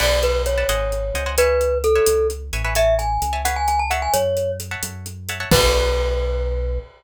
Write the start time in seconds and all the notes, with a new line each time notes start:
0.00 B1 B4 D5 F#5 A5, crash
0.23 B4, closed hi-hat
0.46 C#5, closed hi-hat
0.58 B4 D5 F#5 A5
0.68 G#1 C5 D#5 F#5 G#5, closed hi-hat
0.92 closed hi-hat
1.14 C#2 C5 D#5 F#5 G#5, closed hi-hat
1.26 C5 D#5 F#5 G#5
1.38 B4 C#5 E5 G#5, closed hi-hat
1.61 closed hi-hat
1.84 A4, closed hi-hat
1.95 B4 C#5 E5 G#5
2.06 C#2, closed hi-hat
2.30 closed hi-hat
2.53 A1 B4 C#5 E5 G#5, closed hi-hat
2.64 B4 C#5 E5 G#5
2.75 C#5 E5 G#5 A5, closed hi-hat
2.99 G#5, closed hi-hat
3.22 C#2, closed hi-hat
3.33 C#5 E5 G#5 A5
3.45 B4 C#5 F5 F#5 G#5, closed hi-hat
3.56 G#5
3.68 G#5, closed hi-hat
3.79 A5
3.90 C#5 E5 F#5 A5, closed hi-hat
4.02 G#5
4.14 F#2 C#5, closed hi-hat
4.37 closed hi-hat
4.60 closed hi-hat
4.71 C#5 E5 F#5 A5
4.83 F#2, closed hi-hat
5.06 closed hi-hat
5.29 C#5 E5 F#5 A5, closed hi-hat
5.40 C#5 E5 F#5 A5
5.51 B1 B3 D4 F#4 A4 B4, kick, crash